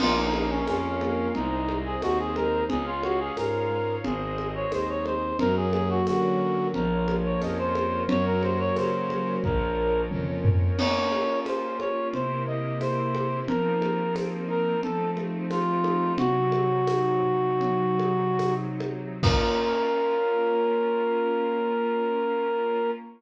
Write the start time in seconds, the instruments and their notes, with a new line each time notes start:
0.00 violin A#1, acoustic grand piano A#3, clarinet F4, string ensemble 1 A#4 C#5 F5, crash, low conga
0.17 clarinet D#4
0.34 acoustic grand piano C#4, clarinet D#4, high conga
0.51 clarinet C#4
0.67 violin F2, clarinet C#4, acoustic grand piano F4, tambourine, high conga
1.01 acoustic grand piano A#3, high conga
1.35 violin C2, acoustic grand piano G#3, clarinet D#4, string ensemble 1 G#4 C5 D#5, low conga
1.68 acoustic grand piano C4, high conga
1.85 clarinet G#4
2.02 violin D#2, acoustic grand piano D#4, clarinet F#4, tambourine, high conga
2.19 clarinet G#4
2.36 acoustic grand piano G#3, clarinet A#4, high conga
2.68 violin C#2, acoustic grand piano G#3, clarinet G#4, string ensemble 1 G#4 C#5 F5, low conga
2.87 clarinet F4
3.03 acoustic grand piano C#4, clarinet F#4, high conga
3.20 clarinet G#4
3.37 violin G#2, acoustic grand piano F4, clarinet A#4, tambourine, high conga
3.70 acoustic grand piano G#3
4.04 violin G#1, acoustic grand piano G#3, string ensemble 1 G#4 C5 D#5, clarinet G#4, low conga
4.37 acoustic grand piano C4, high conga
4.55 clarinet C#5
4.72 violin D#2, acoustic grand piano D#4, clarinet C5, tambourine, high conga
4.89 clarinet C#5
5.06 acoustic grand piano G#3, clarinet C5, high conga
5.39 violin F#2, acoustic grand piano F#3, string ensemble 1 F#4 A#4 C#5, clarinet A#4, low conga
5.56 clarinet G#4
5.73 acoustic grand piano A#3, clarinet G#4, high conga
5.90 clarinet F#4
6.07 violin D3, acoustic grand piano C#4, clarinet F#4, tambourine, high conga
6.39 acoustic grand piano F#3
6.74 violin A#1, acoustic grand piano F3, string ensemble 1 F4 A#4 C#5, clarinet A#4, low conga
7.07 acoustic grand piano A#3, high conga
7.25 clarinet C#5
7.41 violin F2, acoustic grand piano C#4, clarinet D#5, tambourine, high conga
7.58 clarinet C5
7.75 acoustic grand piano F3, clarinet C5, high conga
8.08 violin F#2, acoustic grand piano F#3, string ensemble 1 F#4 A#4 C#5, clarinet C#5, low conga
8.26 clarinet A#4
8.43 acoustic grand piano A#3, clarinet C5, high conga
8.60 clarinet C#5
8.76 violin C#3, acoustic grand piano C#4, clarinet C5, tambourine, high conga
9.10 acoustic grand piano F#3, high conga
9.44 violin A#1, acoustic grand piano F3, string ensemble 1 F4 A#4 C#5, clarinet A#4, kick
9.79 acoustic grand piano A#3
10.11 violin F2, acoustic grand piano C#4, mid tom
10.44 acoustic grand piano F3, floor tom
10.78 acoustic grand piano A#3, string ensemble 1 A#3 C#4 F4, clarinet C#5, crash, low conga
11.12 acoustic grand piano C#4, high conga
11.46 acoustic grand piano F4, clarinet C5, tambourine, high conga
11.80 acoustic grand piano A#3, clarinet C#5, high conga
12.13 string ensemble 1 C3 A#3 E4 G4, acoustic grand piano C3, clarinet C5, low conga
12.46 acoustic grand piano A#3, clarinet D#5
12.81 acoustic grand piano E4, clarinet C5, tambourine, high conga
13.15 acoustic grand piano G4, high conga
13.47 acoustic grand piano F3, string ensemble 1 F3 A#3 C4 D#4, clarinet A#4, low conga
13.81 acoustic grand piano A#3, high conga
14.14 acoustic grand piano C4, tambourine, high conga
14.48 acoustic grand piano D#4, clarinet A#4
14.83 acoustic grand piano F3, string ensemble 1 F3 A3 C4 D#4, clarinet A4, low conga
15.17 acoustic grand piano A3, high conga
15.50 acoustic grand piano C4, clarinet F4, tambourine, high conga
15.84 acoustic grand piano D#4, high conga
16.18 acoustic grand piano C3, string ensemble 1 C3 F#3 D#4, clarinet F#4, low conga
16.52 acoustic grand piano F#3, high conga
16.87 acoustic grand piano D#4, tambourine, high conga
17.23 acoustic grand piano C3
17.61 acoustic grand piano F#3, low conga
17.99 acoustic grand piano D#4, high conga
18.39 acoustic grand piano C3, tambourine, high conga
18.80 acoustic grand piano F#3, high conga
19.23 string ensemble 1 A#3 C#4 F4, acoustic grand piano A#3 C#4 F4, clarinet A#4, kick, crash